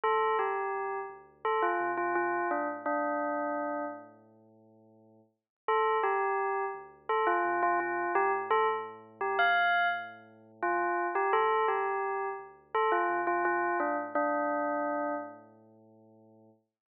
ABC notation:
X:1
M:4/4
L:1/16
Q:1/4=85
K:Dm
V:1 name="Tubular Bells"
A2 G4 z2 A F2 F F2 D z | D6 z10 | A2 G4 z2 A F2 F F2 G z | A z3 G f3 z4 F3 G |
A2 G4 z2 A F2 F F2 D z | D6 z10 |]
V:2 name="Synth Bass 2" clef=bass
D,,2 D,,2 D,,2 D,,4 C,4 A,,2- | A,,16 | D,,2 D,,2 D,,2 D,,4 C,4 A,,2- | A,,16 |
D,,2 D,,2 D,,2 D,,4 C,4 A,,2- | A,,16 |]